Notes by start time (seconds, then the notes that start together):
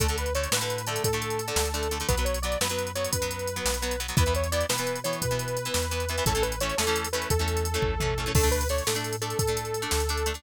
0.00 D2 D3 A3 A4, kick, closed hi-hat
0.08 D3 A3, closed hi-hat
0.18 B4, closed hi-hat
0.26 closed hi-hat
0.35 D3 A3 C#5, closed hi-hat
0.43 closed hi-hat
0.51 A2 D3 A3 B4, snare
0.61 D3 A3, closed hi-hat
0.70 closed hi-hat
0.78 closed hi-hat
0.87 D3 A3 A4, closed hi-hat
0.96 closed hi-hat
1.04 A2 A4, kick, closed hi-hat
1.13 D3 A3, closed hi-hat
1.22 closed hi-hat
1.30 closed hi-hat
1.39 closed hi-hat
1.48 D3 A3, closed hi-hat
1.56 D2, snare
1.65 closed hi-hat
1.74 D3 A3, closed hi-hat
1.83 closed hi-hat
1.91 D3 A3, closed hi-hat
2.00 D3 A3, closed hi-hat
2.08 B1 F#3 B3 B4, kick, closed hi-hat
2.17 F#3 B3, closed hi-hat
2.25 C#5, closed hi-hat
2.34 closed hi-hat
2.42 F#3 B3 D5, closed hi-hat
2.52 closed hi-hat
2.60 F#2 F#3 B3 B4, snare
2.69 F#3 B3, closed hi-hat
2.79 closed hi-hat
2.87 closed hi-hat
2.95 F#3 B3 C#5, closed hi-hat
3.04 closed hi-hat
3.12 F#2 B4, kick, closed hi-hat
3.22 F#3 B3, closed hi-hat
3.31 closed hi-hat
3.39 closed hi-hat
3.47 closed hi-hat
3.56 F#3 B3, closed hi-hat
3.65 B1, snare
3.74 closed hi-hat
3.82 F#3 B3, closed hi-hat
3.91 closed hi-hat
4.00 F#3 B3, closed hi-hat
4.08 F#3 B3, closed hi-hat
4.17 E2 E3 B3 B4, kick, closed hi-hat
4.26 E3 B3, closed hi-hat
4.35 C#5, closed hi-hat
4.44 closed hi-hat
4.52 E3 B3 D5, closed hi-hat
4.61 closed hi-hat
4.69 B2 E3 B3 B4, snare
4.78 E3 B3, closed hi-hat
4.87 closed hi-hat
4.96 closed hi-hat
5.04 E3 B3 C#5, closed hi-hat
5.13 closed hi-hat
5.22 B2 B4, kick, closed hi-hat
5.31 E3 B3, closed hi-hat
5.39 closed hi-hat
5.48 closed hi-hat
5.57 closed hi-hat
5.65 E3 B3, closed hi-hat
5.74 E2, snare
5.82 closed hi-hat
5.91 E3 B3, closed hi-hat
6.00 closed hi-hat
6.09 E3 B3, closed hi-hat
6.18 E3 B3, closed hi-hat
6.25 A1 E3 A3 C#4 A4, kick, closed hi-hat
6.35 E3 A3 C#4, closed hi-hat
6.42 B4, closed hi-hat
6.52 closed hi-hat
6.60 E3 A3 C#4 C#5, closed hi-hat
6.69 closed hi-hat
6.77 E2 E3 A3 C#4 A4, snare
6.87 E3 A3 C#4, closed hi-hat
6.96 closed hi-hat
7.04 closed hi-hat
7.13 E3 A3 C#4 B4, closed hi-hat
7.22 closed hi-hat
7.30 E2 A4, kick, closed hi-hat
7.39 E3 A3 C#4, closed hi-hat
7.48 closed hi-hat
7.57 closed hi-hat
7.65 closed hi-hat
7.74 E3 A3 C#4, closed hi-hat
7.82 A1, kick, floor tom
8.00 E3 A3 C#4, mid tom
8.18 E3 A3 C#4
8.26 E3 A3 C#4
8.34 D2 A3 D4 A4, kick, crash
8.43 A3 D4, closed hi-hat
8.51 B4, closed hi-hat
8.61 closed hi-hat
8.69 A3 D4 C#5, closed hi-hat
8.78 closed hi-hat
8.87 A2 A3 D4 A4, snare
8.95 A3 D4, closed hi-hat
9.04 closed hi-hat
9.13 closed hi-hat
9.22 A3 D4 A4, closed hi-hat
9.30 closed hi-hat
9.39 A2 A4, kick, closed hi-hat
9.47 A3 D4, closed hi-hat
9.57 closed hi-hat
9.65 closed hi-hat
9.74 closed hi-hat
9.82 A3 D4, closed hi-hat
9.91 D2, snare
10.00 closed hi-hat
10.09 A3 D4, closed hi-hat
10.17 closed hi-hat
10.26 A3 D4, closed hi-hat
10.34 A3 D4, closed hi-hat